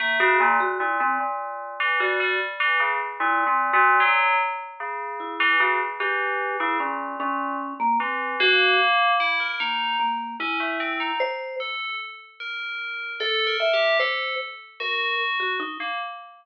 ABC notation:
X:1
M:5/8
L:1/16
Q:1/4=75
K:none
V:1 name="Vibraphone"
^A, ^F A, F E C z4 | ^F2 z4 (3E2 C2 F2 | z6 E2 ^F z | G3 E ^C2 C3 ^A, |
C2 ^F2 z4 ^A,2 | ^A,2 E4 c2 z2 | z6 A2 e2 | c2 z2 ^A2 z ^F ^D z |]
V:2 name="Tubular Bells"
A, ^C, ^A,, z A,, A,, A,,3 E, | G, G, z E, ^C, z (3^A,,2 A,,2 A,,2 | ^F,2 z2 ^C,3 E, C, z | E,3 ^C, ^A,,2 A,,2 z2 |
E,2 ^A,4 E ^A ^D2 | z2 ^C A, =C ^D z2 A2 | z2 ^A4 (3=A2 ^A2 G2 | A2 z2 ^F4 z ^A, |]